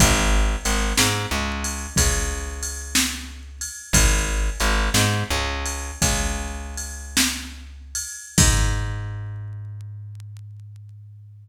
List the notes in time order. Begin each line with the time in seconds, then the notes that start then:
0.00 G#1, kick, ride
0.65 G#1, ride
0.98 G#2, snare
1.31 C#2
1.64 ride
1.96 C#2, kick, ride
2.63 ride
2.95 snare
3.61 ride
3.93 G#1, kick, ride
4.60 G#1, ride
4.94 G#2, snare
5.31 C#2
5.66 ride
6.02 C#2, kick, ride
6.77 ride
7.17 snare
7.95 ride
8.38 G#2, kick, crash